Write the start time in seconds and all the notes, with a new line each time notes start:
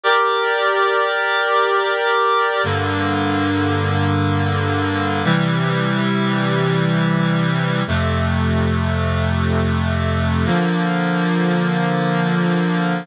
0.03 G4 A#4 D5
2.64 G2 D3 A#3
5.24 C3 E3 G3
7.87 F2 C3 A3
10.45 D3 F3 A#3